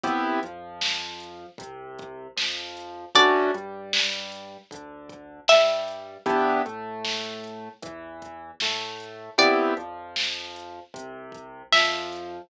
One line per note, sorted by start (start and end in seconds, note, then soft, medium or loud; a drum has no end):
0.03 0.39 C2 medium
0.03 0.40 B3 medium
0.03 0.40 C4 medium
0.03 0.40 E4 medium
0.03 0.40 G4 medium
0.03 kick loud
0.03 closed hi-hat loud
0.43 1.46 F2 medium
0.43 1.46 F3 medium
0.43 closed hi-hat medium
0.81 snare loud
1.20 closed hi-hat medium
1.58 2.28 C2 medium
1.58 2.27 C3 medium
1.58 kick loud
1.58 closed hi-hat loud
1.99 kick loud
1.99 closed hi-hat medium
2.36 3.06 F2 medium
2.36 3.05 F3 medium
2.36 snare loud
2.77 closed hi-hat medium
3.15 3.49 D2 medium
3.15 3.51 A3 medium
3.15 3.51 C#4 medium
3.15 3.51 D4 medium
3.15 3.51 F#4 medium
3.15 3.81 D5 medium
3.15 kick loud
3.15 closed hi-hat loud
3.54 4.58 G2 medium
3.54 4.57 G3 medium
3.54 closed hi-hat medium
3.93 snare loud
4.32 closed hi-hat medium
4.71 5.39 D2 medium
4.71 5.40 D3 medium
4.71 kick loud
4.71 closed hi-hat loud
5.09 kick loud
5.09 closed hi-hat medium
5.48 6.18 G2 medium
5.48 6.17 G3 medium
5.48 6.20 E5 medium
5.48 snare loud
5.88 closed hi-hat medium
6.26 6.61 E2 medium
6.26 6.62 B3 medium
6.26 6.62 D4 medium
6.26 6.62 E4 medium
6.26 6.62 G4 medium
6.26 kick loud
6.26 closed hi-hat loud
6.66 7.69 A2 medium
6.66 7.68 A3 medium
6.66 closed hi-hat medium
7.05 snare loud
7.44 closed hi-hat medium
7.82 8.52 E2 medium
7.82 8.51 E3 medium
7.82 kick loud
7.82 closed hi-hat loud
8.22 kick medium
8.22 closed hi-hat medium
8.60 9.29 A2 medium
8.60 9.30 A3 medium
8.60 snare loud
9.00 closed hi-hat medium
9.38 9.72 C2 medium
9.38 9.74 B3 medium
9.38 9.74 C4 medium
9.38 9.74 E4 medium
9.38 9.74 G4 medium
9.38 10.11 D5 medium
9.38 kick loud
9.38 closed hi-hat loud
9.77 10.80 F2 medium
9.77 10.80 F3 medium
9.77 closed hi-hat medium
10.16 snare loud
10.56 closed hi-hat medium
10.94 11.63 C2 medium
10.94 11.62 C3 medium
10.94 kick loud
10.94 closed hi-hat loud
11.32 kick medium
11.32 closed hi-hat medium
11.72 12.40 F2 medium
11.72 12.42 F3 medium
11.72 12.48 E5 medium
11.72 snare loud
12.13 closed hi-hat medium